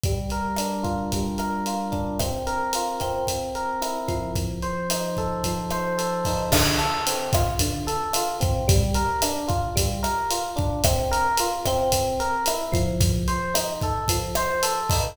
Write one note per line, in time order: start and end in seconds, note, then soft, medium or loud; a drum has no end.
0.03 1.13 G3 medium
0.03 kick loud
0.03 closed hi-hat loud
0.29 1.38 A#4 medium
0.29 kick medium
0.29 closed hi-hat medium
0.56 1.91 D4 medium
0.56 cross-stick medium
0.56 closed hi-hat loud
0.83 1.66 F4 medium
0.83 kick medium
0.83 closed hi-hat medium
1.12 2.16 G3 medium
1.12 kick medium
1.12 closed hi-hat loud
1.38 2.16 A#4 medium
1.38 cross-stick medium
1.38 closed hi-hat medium
1.66 2.18 F4 medium
1.66 closed hi-hat loud
1.92 2.17 D4 medium
1.92 kick medium
1.92 closed hi-hat medium
2.19 3.00 C4 medium
2.19 kick medium
2.19 cross-stick loud
2.19 closed hi-hat loud
2.47 3.24 A#4 medium
2.47 closed hi-hat medium
2.73 3.26 F4 medium
2.73 closed hi-hat loud
3.00 4.31 C4 medium
3.00 kick medium
3.00 cross-stick medium
3.00 closed hi-hat medium
3.27 kick medium
3.27 closed hi-hat loud
3.55 4.32 A#4 medium
3.55 closed hi-hat medium
3.81 4.33 E4 medium
3.81 cross-stick medium
3.81 closed hi-hat loud
4.08 5.45 F3 medium
4.08 kick medium
4.08 closed hi-hat medium
4.35 kick loud
4.35 closed hi-hat loud
4.62 5.71 C5 medium
4.62 closed hi-hat medium
4.90 6.26 D#4 medium
4.90 cross-stick loud
4.90 closed hi-hat loud
5.17 5.97 A4 medium
5.17 kick medium
5.17 closed hi-hat medium
5.44 6.48 F3 medium
5.44 kick medium
5.44 closed hi-hat loud
5.70 6.49 C5 medium
5.70 cross-stick loud
5.70 closed hi-hat medium
5.98 6.49 A4 medium
5.98 closed hi-hat loud
6.25 6.52 D#4 medium
6.25 kick medium
6.25 open hi-hat medium
6.52 6.79 D3 loud
6.52 kick loud
6.52 cross-stick loud
6.52 crash loud
6.78 7.05 A4 medium
6.78 closed hi-hat medium
7.07 7.34 C4 medium
7.07 closed hi-hat loud
7.33 7.61 F4 medium
7.33 kick loud
7.33 cross-stick loud
7.33 closed hi-hat loud
7.59 7.87 D3 medium
7.59 kick loud
7.59 closed hi-hat loud
7.87 8.14 A4 medium
7.87 closed hi-hat loud
8.13 8.42 F4 medium
8.13 cross-stick loud
8.13 closed hi-hat loud
8.40 8.66 C4 medium
8.40 kick loud
8.40 closed hi-hat loud
8.68 8.95 G3 loud
8.68 kick loud
8.68 closed hi-hat loud
8.94 9.22 A#4 medium
8.94 kick medium
8.94 closed hi-hat loud
9.22 9.50 D4 medium
9.22 cross-stick loud
9.22 closed hi-hat loud
9.48 9.75 F4 medium
9.48 kick loud
9.48 closed hi-hat medium
9.76 10.03 G3 medium
9.76 kick loud
9.76 closed hi-hat loud
10.03 10.30 A#4 medium
10.03 cross-stick loud
10.03 closed hi-hat loud
10.31 10.58 F4 medium
10.31 closed hi-hat loud
10.56 10.82 D4 medium
10.56 kick loud
10.56 closed hi-hat medium
10.84 11.12 C4 loud
10.84 kick loud
10.84 cross-stick loud
10.84 closed hi-hat loud
11.11 11.38 A#4 loud
11.11 closed hi-hat loud
11.37 11.67 F4 medium
11.37 closed hi-hat loud
11.65 12.21 C4 loud
11.65 kick medium
11.65 cross-stick loud
11.65 closed hi-hat loud
11.92 kick medium
11.92 closed hi-hat loud
12.20 12.47 A#4 medium
12.20 closed hi-hat medium
12.46 12.74 E4 medium
12.46 cross-stick loud
12.46 closed hi-hat loud
12.72 13.26 F3 loud
12.72 kick loud
12.72 closed hi-hat loud
13.00 kick loud
13.00 closed hi-hat loud
13.28 13.55 C5 medium
13.28 closed hi-hat loud
13.54 13.81 D#4 medium
13.54 cross-stick loud
13.54 closed hi-hat loud
13.81 14.10 A4 medium
13.81 kick loud
13.81 closed hi-hat medium
14.08 14.36 F3 medium
14.08 kick loud
14.08 closed hi-hat loud
14.35 14.64 C5 medium
14.35 cross-stick loud
14.35 closed hi-hat loud
14.63 14.90 A4 medium
14.63 closed hi-hat loud
14.90 15.15 D#4 medium
14.90 kick loud
14.90 open hi-hat loud